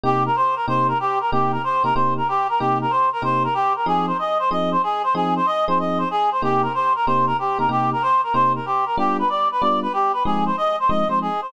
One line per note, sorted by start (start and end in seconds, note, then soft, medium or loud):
0.04 0.29 C3 loud
0.04 0.29 A#3 medium
0.04 0.29 D#4 medium
0.04 0.29 G4 medium
0.04 0.24 G4 medium
0.26 0.36 A#4 medium
0.36 0.55 C5 medium
0.56 0.66 A#4 medium
0.68 0.93 C3 medium
0.68 0.93 A#3 medium
0.68 0.93 D#4 medium
0.68 0.93 G4 medium
0.68 0.87 C5 medium
0.88 0.98 A#4 medium
1.00 1.19 G4 medium
1.21 1.31 A#4 medium
1.32 1.58 C3 medium
1.32 1.58 A#3 medium
1.32 1.58 D#4 medium
1.32 1.58 G4 medium
1.32 1.52 G4 medium
1.52 1.62 A#4 medium
1.64 1.83 C5 medium
1.84 1.92 C3 medium
1.84 1.92 A#3 medium
1.84 1.92 D#4 medium
1.84 1.92 G4 medium
1.84 1.94 A#4 medium
1.95 2.21 C3 medium
1.95 2.21 A#3 medium
1.95 2.21 D#4 medium
1.95 2.21 G4 medium
1.95 2.14 C5 medium
2.17 2.28 A#4 medium
2.28 2.47 G4 medium
2.49 2.60 A#4 medium
2.59 2.86 C3 medium
2.59 2.86 A#3 medium
2.59 2.86 D#4 medium
2.59 2.78 G4 medium
2.59 2.86 G4 medium
2.81 2.92 A#4 medium
2.90 3.10 C5 medium
3.13 3.23 A#4 medium
3.22 3.47 C3 medium
3.22 3.47 A#3 medium
3.22 3.47 D#4 medium
3.22 3.47 G4 medium
3.22 3.43 C5 medium
3.44 3.54 A#4 medium
3.54 3.73 G4 medium
3.76 3.86 A#4 medium
3.86 4.12 F3 loud
3.86 4.12 C4 medium
3.86 4.12 D#4 medium
3.86 4.12 G#4 medium
3.86 4.06 G#4 medium
4.07 4.17 C5 medium
4.19 4.38 D#5 medium
4.39 4.50 C5 medium
4.51 4.76 F3 medium
4.51 4.76 C4 medium
4.51 4.76 D#4 medium
4.51 4.76 G#4 medium
4.51 4.70 D#5 medium
4.72 4.82 C5 medium
4.83 5.02 G#4 medium
5.04 5.14 C5 medium
5.15 5.40 F3 medium
5.15 5.40 C4 loud
5.15 5.40 D#4 medium
5.15 5.40 G#4 medium
5.15 5.34 G#4 medium
5.36 5.46 C5 medium
5.46 5.65 D#5 medium
5.68 6.04 F3 medium
5.68 6.04 C4 loud
5.68 6.04 D#4 medium
5.68 6.04 G#4 loud
5.68 5.78 C5 medium
5.79 5.99 D#5 medium
5.98 6.09 C5 medium
6.11 6.30 G#4 medium
6.32 6.42 C5 medium
6.42 6.68 C3 medium
6.42 6.68 A#3 loud
6.42 6.68 D#4 medium
6.42 6.68 G4 medium
6.42 6.62 G4 medium
6.62 6.73 A#4 medium
6.74 6.93 C5 medium
6.95 7.06 A#4 medium
7.06 7.32 C3 loud
7.06 7.32 A#3 loud
7.06 7.32 D#4 medium
7.06 7.32 G4 medium
7.06 7.26 C5 medium
7.27 7.37 A#4 medium
7.39 7.58 G4 medium
7.59 7.67 C3 medium
7.59 7.67 A#3 medium
7.59 7.67 D#4 medium
7.59 7.67 G4 medium
7.59 7.69 A#4 medium
7.69 7.94 C3 medium
7.69 7.94 A#3 medium
7.69 7.94 D#4 medium
7.69 7.94 G4 medium
7.69 7.90 G4 medium
7.92 8.03 A#4 medium
8.02 8.21 C5 medium
8.23 8.34 A#4 medium
8.34 8.59 C3 medium
8.34 8.59 A#3 medium
8.34 8.59 D#4 medium
8.34 8.59 G4 medium
8.34 8.53 C5 medium
8.55 8.66 A#4 medium
8.66 8.85 G4 medium
8.86 8.96 A#4 medium
8.98 9.23 G3 loud
8.98 9.23 B3 medium
8.98 9.23 D4 loud
8.98 9.23 F4 medium
8.98 9.17 G4 medium
9.19 9.29 B4 medium
9.29 9.48 D5 medium
9.52 9.62 B4 medium
9.61 9.87 G3 loud
9.61 9.87 B3 medium
9.61 9.87 D4 medium
9.61 9.87 F4 medium
9.61 9.80 D5 medium
9.82 9.93 B4 medium
9.93 10.12 G4 medium
10.13 10.23 B4 medium
10.25 10.51 F3 medium
10.25 10.51 G#3 medium
10.25 10.51 C4 medium
10.25 10.51 D#4 medium
10.25 10.45 G#4 medium
10.46 10.56 C5 medium
10.57 10.76 D#5 medium
10.80 10.90 C5 medium
10.89 11.04 F3 medium
10.89 11.04 G#3 loud
10.89 11.04 C4 medium
10.89 11.04 D#4 medium
10.89 11.08 D#5 medium
11.09 11.29 F3 medium
11.09 11.29 G#3 medium
11.09 11.29 C4 medium
11.09 11.29 D#4 medium
11.09 11.19 C5 medium
11.22 11.41 G#4 medium
11.42 11.52 C5 medium